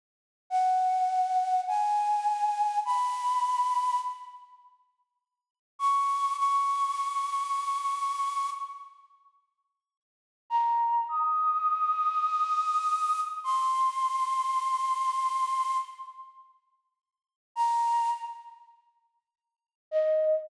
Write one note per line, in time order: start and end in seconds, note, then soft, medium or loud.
0.50 1.61 F#5 medium
1.68 2.79 G#5 medium
2.85 3.99 B5 medium
5.79 6.36 C#6 medium
6.38 8.50 C#6 medium
10.50 11.05 A#5 medium
11.09 13.20 D#6 medium
13.44 15.77 C6 medium
17.56 18.11 A#5 medium
19.91 20.49 D#5 medium